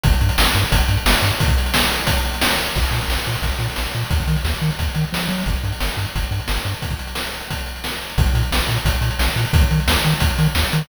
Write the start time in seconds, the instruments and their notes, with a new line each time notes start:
0.04 synth bass 1 G1, kick, closed hi-hat
0.13 closed hi-hat
0.21 synth bass 1 G2, closed hi-hat
0.29 closed hi-hat
0.38 synth bass 1 G1, snare
0.46 closed hi-hat
0.55 synth bass 1 G2, closed hi-hat
0.64 closed hi-hat
0.72 synth bass 1 G1, kick, closed hi-hat
0.80 closed hi-hat
0.88 synth bass 1 G2, closed hi-hat
0.97 closed hi-hat
1.06 synth bass 1 G1, snare
1.15 closed hi-hat
1.22 synth bass 1 G2, closed hi-hat
1.31 closed hi-hat
1.40 kick, closed hi-hat
1.48 kick, closed hi-hat
1.58 closed hi-hat
1.66 closed hi-hat
1.74 snare
1.83 closed hi-hat
1.92 closed hi-hat
1.99 closed hi-hat
2.07 kick, closed hi-hat
2.17 closed hi-hat
2.25 closed hi-hat
2.34 closed hi-hat
2.41 snare
2.49 closed hi-hat
2.58 closed hi-hat
2.66 closed hi-hat
2.75 synth bass 1 A#1, kick, crash
2.84 closed hi-hat
2.91 synth bass 1 A#2, closed hi-hat
3.01 closed hi-hat
3.08 synth bass 1 A#1, snare
3.17 closed hi-hat
3.26 synth bass 1 A#2, closed hi-hat
3.34 closed hi-hat
3.42 synth bass 1 A#1, kick, closed hi-hat
3.52 closed hi-hat
3.59 synth bass 1 A#2, closed hi-hat
3.70 closed hi-hat
3.76 synth bass 1 A#1, snare
3.85 closed hi-hat
3.94 synth bass 1 A#2, closed hi-hat
4.03 closed hi-hat
4.10 synth bass 1 D#2, kick, closed hi-hat
4.20 kick, closed hi-hat
4.27 synth bass 1 D#3, closed hi-hat
4.37 closed hi-hat
4.45 synth bass 1 D#2, snare
4.54 closed hi-hat
4.62 synth bass 1 D#3, closed hi-hat
4.71 closed hi-hat
4.79 synth bass 1 D#2, kick, closed hi-hat
4.88 closed hi-hat
4.95 synth bass 1 D#3, closed hi-hat
5.04 closed hi-hat
5.13 synth bass 1 F3, snare
5.21 closed hi-hat
5.28 synth bass 1 F#3, closed hi-hat
5.38 open hi-hat
5.46 synth bass 1 G1, kick, closed hi-hat
5.56 closed hi-hat
5.64 synth bass 1 G2, closed hi-hat
5.72 closed hi-hat
5.80 synth bass 1 G1, snare
5.89 closed hi-hat
5.97 synth bass 1 G2, closed hi-hat
6.05 closed hi-hat
6.15 synth bass 1 G1, kick, closed hi-hat
6.23 closed hi-hat
6.31 synth bass 1 G2, closed hi-hat
6.40 closed hi-hat
6.48 synth bass 1 G1, snare
6.57 closed hi-hat
6.65 synth bass 1 G2, closed hi-hat
6.74 closed hi-hat
6.82 kick, closed hi-hat
6.90 kick, closed hi-hat
6.99 closed hi-hat
7.07 closed hi-hat
7.15 snare
7.24 closed hi-hat
7.34 closed hi-hat
7.40 closed hi-hat
7.50 kick, closed hi-hat
7.58 closed hi-hat
7.66 closed hi-hat
7.76 closed hi-hat
7.84 snare
7.92 closed hi-hat
8.01 closed hi-hat
8.10 closed hi-hat
8.18 synth bass 1 A#1, kick, closed hi-hat
8.26 closed hi-hat
8.33 synth bass 1 A#2, closed hi-hat
8.43 closed hi-hat
8.52 synth bass 1 A#1, snare
8.60 closed hi-hat
8.69 synth bass 1 A#2, closed hi-hat
8.77 closed hi-hat
8.85 synth bass 1 A#1, kick, closed hi-hat
8.95 closed hi-hat
9.01 synth bass 1 A#2, closed hi-hat
9.11 closed hi-hat
9.19 synth bass 1 A#1, snare
9.27 closed hi-hat
9.36 synth bass 1 A#2, closed hi-hat
9.45 open hi-hat
9.53 synth bass 1 D#2, kick, closed hi-hat
9.61 kick, closed hi-hat
9.71 synth bass 1 D#3, closed hi-hat
9.80 closed hi-hat
9.88 synth bass 1 D#2, snare
9.96 closed hi-hat
10.04 synth bass 1 D#3, closed hi-hat
10.13 closed hi-hat
10.20 synth bass 1 D#2, kick, closed hi-hat
10.30 closed hi-hat
10.39 synth bass 1 D#3, closed hi-hat
10.46 closed hi-hat
10.55 synth bass 1 D#2, snare
10.64 closed hi-hat
10.72 synth bass 1 D#3, closed hi-hat
10.81 open hi-hat